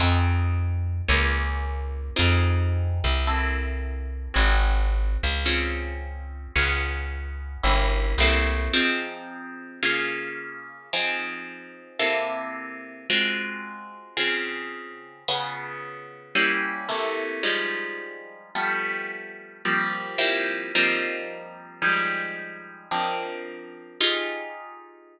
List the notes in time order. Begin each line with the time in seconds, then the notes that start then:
0.00 F2 C4 D#4 F4 G#4
1.08 C#2 A#3 C#4 F4 G#4
2.16 F2 C4 D#4 F4 G#4
3.04 C2
3.27 A#3 C4 E4 A4
4.34 G#1 C4 F4 F#4 G#4
5.23 C#2
5.46 C4 C#4 F4 G#4
6.56 C#2 B3 C#4 F4 G#4
7.64 G1 A#3 C#4 E4 G4
8.18 C2 A3 A#3 C4 E4
8.74 F3 C4 D#4 G#4
9.83 C#3 A#3 F4 G#4
10.93 F3 C4 D#4 G#4
11.99 C3 A#3 E4 A4
13.10 G#3 C4 F4 F#4
14.17 C#3 C4 F4 G#4
15.28 C#3 B3 F4 G#4
16.35 G3 A#3 C#4 E4
16.89 C3 A3 A#3 E4
17.43 F3 G3 G#3 D#4
18.55 F3 G3 A3 B3
19.65 F3 G3 A#3 C4
20.18 F3 G3 A#3 C4 E4
20.75 F3 G3 A#3 C4 D#4
21.82 F3 G3 G#3 D#4
22.91 F3 A#3 C4 D4 D#4
24.01 D#4 F4 G4 G#4